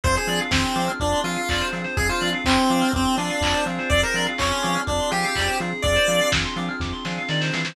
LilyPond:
<<
  \new Staff \with { instrumentName = "Lead 1 (square)" } { \time 4/4 \key f \minor \tempo 4 = 124 c''16 aes'8 r16 c'4 d'8 f'4 r8 | aes'16 f'8 r16 c'4 c'8 d'4 r8 | d''16 bes'8 r16 des'4 d'8 g'4 r8 | d''4 r2. | }
  \new Staff \with { instrumentName = "Drawbar Organ" } { \time 4/4 \key f \minor <c' d' f' aes'>8 <c' d' f' aes'>4 <c' d' f' aes'>4 <c' d' f' aes'>4 <c' d' f' aes'>8 | <c' d' f' aes'>8 <c' d' f' aes'>4 <c' d' f' aes'>4 <c' d' f' aes'>4 <c' d' f' aes'>8~ | <c' d' f' aes'>8 <c' d' f' aes'>4 <c' d' f' aes'>4 <c' d' f' aes'>4 <c' d' f' aes'>8 | <c' d' f' aes'>8 <c' d' f' aes'>4 <c' d' f' aes'>4 <c' d' f' aes'>4 <c' d' f' aes'>8 | }
  \new Staff \with { instrumentName = "Electric Piano 2" } { \time 4/4 \key f \minor aes'16 c''16 d''16 f''16 aes''16 c'''16 d'''16 f'''16 d'''16 c'''16 aes''16 f''16 d''16 c''16 aes'16 c''16 | aes'16 c''16 d''16 f''16 aes''16 c'''16 d'''16 f'''16 d'''16 c'''16 aes''16 f''16 d''16 c''16 aes'16 c''16 | aes'16 c''16 d''16 f''16 aes''16 c'''16 d'''16 f'''16 d'''16 c'''16 aes''16 f''16 d''16 c''16 aes'8~ | aes'16 c''16 d''16 f''16 aes''16 c'''16 d'''16 f'''16 d'''16 c'''16 aes''16 f''16 d''16 c''16 aes'16 c''16 | }
  \new Staff \with { instrumentName = "Synth Bass 1" } { \clef bass \time 4/4 \key f \minor f,8 f8 f,8 f8 f,8 f8 f,8 f8 | f,8 f8 f,8 f8 f,8 f8 f,8 f8 | f,8 f8 f,8 f8 f,8 f8 f,8 f8 | f,8 f8 f,8 f8 f,8 f8 ees8 e8 | }
  \new Staff \with { instrumentName = "Pad 5 (bowed)" } { \time 4/4 \key f \minor <c' d' f' aes'>1 | <c' d' f' aes'>1 | <c' d' f' aes'>1 | <c' d' f' aes'>1 | }
  \new DrumStaff \with { instrumentName = "Drums" } \drummode { \time 4/4 <hh bd>8 hho8 <bd sn>8 hho8 <hh bd>8 hho8 <hc bd>8 hho8 | <hh bd>8 hho8 <hc bd>8 hho8 <hh bd>8 hho8 <hc bd>8 hho8 | <hh bd>8 hho8 <hc bd>8 hho8 <hh bd>8 hho8 <hc bd>8 hho8 | <hh bd>8 hho8 <bd sn>8 hho8 <bd sn>8 sn8 sn16 sn16 sn16 sn16 | }
>>